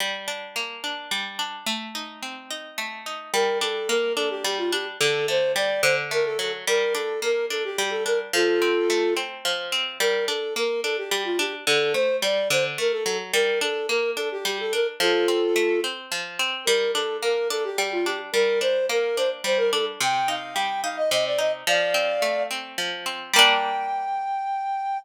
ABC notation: X:1
M:6/8
L:1/16
Q:3/8=72
K:Gm
V:1 name="Flute"
z12 | z12 | B2 A2 B2 A G G F G z | A2 c2 d2 c z B A A z |
B2 A2 B2 A G G A B z | [FA]6 z6 | B2 A2 B2 A G G F G z | A2 c2 d2 c z B A A z |
B2 A2 B2 A G G A B z | [FA]6 z6 | B2 A2 B2 A G G F G z | B2 c2 B2 c z c B A z |
g2 f2 g2 f e e d e z | [df]6 z6 | g12 |]
V:2 name="Pizzicato Strings"
G,2 D2 B,2 D2 G,2 D2 | A,2 E2 C2 E2 A,2 E2 | G,2 D2 B,2 D2 G,2 D2 | D,2 A,2 G,2 D,2 A,2 ^F,2 |
G,2 D2 B,2 D2 G,2 D2 | F,2 C2 A,2 C2 F,2 C2 | G,2 D2 B,2 D2 G,2 D2 | D,2 A,2 G,2 D,2 A,2 ^F,2 |
G,2 D2 B,2 D2 G,2 D2 | F,2 C2 A,2 C2 F,2 C2 | G,2 D2 B,2 D2 G,2 D2 | G,2 D2 B,2 D2 G,2 D2 |
C,2 E2 G,2 E2 C,2 E2 | F,2 C2 A,2 C2 F,2 C2 | [G,B,D]12 |]